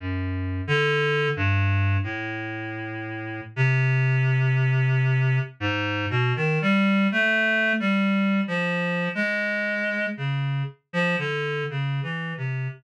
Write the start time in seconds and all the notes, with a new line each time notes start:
0.00 F#2
0.67 D3
1.36 G2
2.03 A2
3.56 C3
5.60 G#2
6.10 B2
6.36 D#3
6.62 G3
7.12 A3
7.80 G3
8.48 F3
9.15 G#3
10.17 C#3
10.93 F3
11.18 D3
11.70 C#3
12.03 E3
12.37 C3